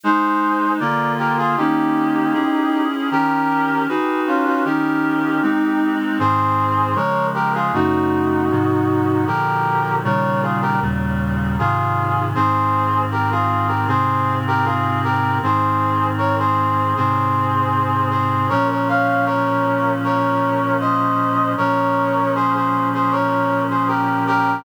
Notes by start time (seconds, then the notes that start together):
0.04 G#3 D#4 G#4 C5
0.80 D3 A#3 F4 A#4 D5
1.18 G4 A#4
1.38 F4 G#4
1.57 D#3 A#3 C#4 D#4 G4
2.33 C#4 E4 G#4
3.11 D#3 C#4 G4 A#4
3.88 D#4 F#4 G#4 B4
4.27 C#4 F4
4.45 C#4 F4
4.64 D#3 C#4 D#4 G4 A#4
5.42 G#3 C4 D#4
6.19 G#2 D#3 C4 G#4 C5
6.95 C#3 F3 G#3 A#4 C#5
7.34 G4 A#4
7.54 F4 G#4
7.73 F#2 C#3 A3 D#4 F#4
8.50 G#2 C3 F3
9.26 A#2 D3 F3 G4 A#4
10.04 A#2 C#3 D#3 G3 A#4 C#5
10.42 F4 G#4
10.62 G4 A#4
10.81 D#2 A#2 C#3 G3
11.59 G#2 C3 D#3 F4 G#4
12.35 G#2 D#3 C4 G#4 C5
13.12 G4 A#4
13.31 F4 G#4
13.68 G4 A#4
13.87 G#2 C3 C4 G#4 C5
14.47 G4 A#4
14.65 F4 G#4
15.04 G4 A#4
15.42 G#2 D#3 C4 G#4 C5
16.18 A#4 C#5
16.39 G#4 C5
16.96 G#2 C3 C4 G#4 C5
18.10 G#4 C5
18.49 A#2 F3 C#4 A#4 C#5
18.70 A#4 C#5
18.88 C#5 F5
19.26 A#4 C#5
20.04 A#4 C#5
20.80 C5 D#5
21.57 A#2 F3 C#4 A#4 C#5
22.35 G#4 C5
22.54 G#4 C5
22.94 G#4 C5
23.11 A#4 C#5
23.70 G#4 C5
23.88 G4 A#4
24.27 G4 A#4